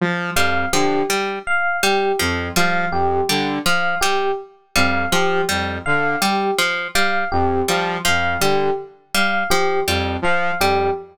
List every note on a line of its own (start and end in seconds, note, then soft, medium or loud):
0.01 0.30 F3 medium
0.35 0.65 F2 medium
0.35 0.66 G3 medium
0.35 0.65 F5 medium
0.73 1.03 D3 medium
0.73 1.02 F3 medium
0.73 1.02 G4 medium
1.10 1.39 G3 medium
1.47 1.76 F5 medium
1.83 2.12 G3 medium
1.83 2.13 G4 medium
2.19 2.50 F2 medium
2.19 2.49 F3 medium
2.56 2.85 F3 medium
2.56 2.85 G3 medium
2.56 2.86 F5 medium
2.91 3.21 F2 medium
2.91 3.22 G4 medium
3.29 3.59 D3 medium
3.29 3.59 G3 medium
3.66 3.95 F3 medium
3.66 3.95 F5 medium
4.01 4.32 G3 medium
4.01 4.30 G4 medium
4.76 5.05 F2 medium
4.76 5.05 G3 medium
4.76 5.05 F5 medium
5.12 5.41 F3 medium
5.12 5.42 F3 medium
5.12 5.42 G4 medium
5.49 5.79 F2 medium
5.49 5.78 G3 medium
5.86 6.16 D3 medium
5.86 6.15 F5 medium
6.21 6.51 G3 medium
6.21 6.51 G4 medium
6.59 6.88 F3 medium
6.95 7.25 G3 medium
6.95 7.24 F5 medium
7.32 7.62 F2 medium
7.32 7.61 G4 medium
7.68 7.98 F3 medium
7.68 7.98 G3 medium
8.05 8.37 F2 medium
8.05 8.34 F3 medium
8.05 8.35 F5 medium
8.41 8.70 D3 medium
8.41 8.71 G3 medium
8.41 8.71 G4 medium
9.14 9.44 G3 medium
9.14 9.44 F5 medium
9.50 9.80 F3 medium
9.50 9.80 G4 medium
9.88 10.17 F2 medium
9.88 10.17 G3 medium
10.22 10.51 F3 medium
10.22 10.54 F5 medium
10.60 10.89 F2 medium
10.60 10.90 G3 medium
10.60 10.90 G4 medium